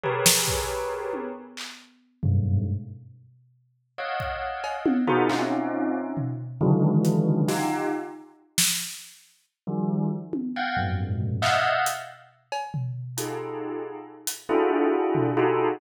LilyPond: <<
  \new Staff \with { instrumentName = "Tubular Bells" } { \time 6/8 \tempo 4. = 91 <g' aes' bes' b' des''>2. | r2 <ges, g, aes,>4 | r2. | <des'' ees'' f'' ges''>2~ <des'' ees'' f'' ges''>8 <ees' f' ges' aes' bes' c''>8 |
<c' des' ees' f'>2 r4 | <des d ees e ges aes>2 <ees' f' g'>4 | r2. | r4 <ees f g>4 r4 |
<f'' ges'' g''>8 <f, ges, aes, bes,>4. <ees'' e'' f'' ges''>4 | r2. | <ees' f' g' aes' a'>2 r4 | <d' e' f' ges' aes' a'>2 <ees' f' ges' g' aes' a'>4 | }
  \new DrumStaff \with { instrumentName = "Drums" } \drummode { \time 6/8 tomfh8 sn8 bd8 r4 tommh8 | r8 hc4 r8 tomfh4 | r4. r4. | r8 bd4 cb8 tommh8 tomfh8 |
hc4. r8 tomfh4 | r4 hh8 r8 sn4 | r4. sn4. | r4. r4 tommh8 |
r4. tomfh8 hc4 | hh4. cb8 tomfh4 | hh4. r4 hh8 | r4. tomfh4. | }
>>